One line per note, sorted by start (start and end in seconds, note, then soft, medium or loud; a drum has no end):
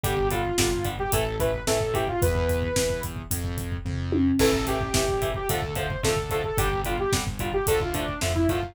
0.04 0.50 G1 loud
0.04 0.15 D3 medium
0.04 0.15 G3 medium
0.04 0.28 G4 medium
0.04 kick medium
0.04 closed hi-hat medium
0.17 kick medium
0.30 0.42 D3 medium
0.30 0.42 G3 medium
0.30 0.87 F4 medium
0.30 kick medium
0.30 closed hi-hat medium
0.45 kick medium
0.58 1.04 G1 medium
0.58 0.69 D3 medium
0.58 0.69 G3 medium
0.58 kick medium
0.58 snare loud
0.73 kick medium
0.85 0.96 D3 medium
0.85 0.96 G3 medium
0.85 kick medium
0.85 closed hi-hat medium
0.99 1.12 G4 medium
0.99 kick medium
1.12 1.59 A1 medium
1.12 1.24 E3 medium
1.12 1.24 A3 medium
1.12 1.36 A4 medium
1.12 kick medium
1.12 closed hi-hat medium
1.40 1.51 E3 medium
1.40 1.51 A3 medium
1.40 1.63 B4 medium
1.40 kick medium
1.40 closed hi-hat medium
1.54 kick medium
1.67 2.14 A1 medium
1.67 1.78 E3 medium
1.67 1.78 A3 medium
1.67 1.94 A4 medium
1.67 kick medium
1.67 snare medium
1.80 kick medium
1.94 2.05 E3 medium
1.94 2.05 A3 medium
1.94 2.07 G4 medium
1.94 kick medium
1.94 closed hi-hat medium
2.07 2.21 F4 medium
2.07 kick medium
2.22 2.69 E2 loud
2.22 3.01 B4 medium
2.22 kick medium
2.22 closed hi-hat medium
2.35 kick medium
2.49 kick medium
2.49 closed hi-hat medium
2.62 kick medium
2.76 3.23 E2 medium
2.76 kick medium
2.76 snare medium
2.90 kick medium
3.03 kick medium
3.03 closed hi-hat medium
3.16 kick medium
3.31 3.77 F2 medium
3.31 kick medium
3.31 closed hi-hat medium
3.44 kick medium
3.58 kick medium
3.58 closed hi-hat medium
3.72 kick medium
3.85 4.31 F2 medium
3.85 kick medium
3.85 floor tom medium
4.12 high tom medium
4.39 4.86 A1 loud
4.39 4.51 E3 loud
4.39 4.51 A3 medium
4.39 4.65 A4 medium
4.39 kick medium
4.39 crash medium
4.53 kick medium
4.67 4.78 E3 medium
4.67 4.78 A3 medium
4.67 5.30 G4 medium
4.67 kick medium
4.67 closed hi-hat medium
4.81 kick medium
4.94 5.41 A1 medium
4.94 5.05 E3 medium
4.94 5.05 A3 medium
4.94 kick medium
4.94 snare medium
5.08 kick medium
5.22 5.33 E3 medium
5.22 5.33 A3 medium
5.22 kick medium
5.22 closed hi-hat medium
5.34 5.49 G4 medium
5.34 kick medium
5.49 5.96 D2 medium
5.49 5.61 D3 medium
5.49 5.61 F3 medium
5.49 5.61 A3 medium
5.49 5.74 A4 medium
5.49 kick medium
5.49 closed hi-hat medium
5.62 kick medium
5.75 5.87 D3 medium
5.75 5.87 F3 medium
5.75 5.87 A3 medium
5.75 6.02 C5 medium
5.75 kick medium
5.75 closed hi-hat medium
5.90 kick medium
6.03 6.50 D2 medium
6.03 6.14 D3 medium
6.03 6.14 F3 medium
6.03 6.14 A3 medium
6.03 6.29 A4 medium
6.03 kick medium
6.03 snare medium
6.16 kick medium
6.30 6.42 D3 medium
6.30 6.42 F3 medium
6.30 6.42 A3 medium
6.30 6.44 A4 medium
6.30 kick medium
6.30 closed hi-hat medium
6.44 6.58 A4 medium
6.44 kick medium
6.58 7.04 G1 loud
6.58 6.69 D3 medium
6.58 6.69 G3 medium
6.58 6.81 G4 medium
6.58 kick medium
6.58 closed hi-hat medium
6.73 kick medium
6.85 6.96 D3 medium
6.85 6.96 G3 medium
6.85 6.99 F4 medium
6.85 kick medium
6.85 closed hi-hat medium
6.98 7.13 G4 medium
6.98 kick medium
7.13 7.59 G1 medium
7.13 7.24 D3 medium
7.13 7.24 G3 medium
7.13 kick medium
7.13 snare medium
7.27 kick medium
7.39 7.51 D3 medium
7.39 7.51 G3 medium
7.39 7.53 F4 medium
7.39 kick medium
7.39 closed hi-hat medium
7.53 7.66 G4 medium
7.53 kick medium
7.67 8.14 D2 loud
7.67 7.79 D3 medium
7.67 7.79 F3 medium
7.67 7.79 A3 medium
7.67 7.80 A4 medium
7.67 kick medium
7.67 closed hi-hat medium
7.80 7.94 F4 medium
7.80 kick medium
7.94 8.05 D3 medium
7.94 8.05 F3 medium
7.94 8.05 A3 medium
7.94 8.20 D4 medium
7.94 kick medium
7.94 closed hi-hat medium
8.08 kick medium
8.21 8.46 F2 medium
8.21 8.33 D3 medium
8.21 8.33 F3 medium
8.21 8.33 A3 medium
8.21 kick medium
8.21 snare medium
8.35 8.48 E4 medium
8.35 kick medium
8.49 8.74 F#2 medium
8.49 8.60 D3 medium
8.49 8.60 F3 medium
8.49 8.60 A3 medium
8.49 8.73 F4 medium
8.49 kick medium
8.49 closed hi-hat medium
8.63 kick medium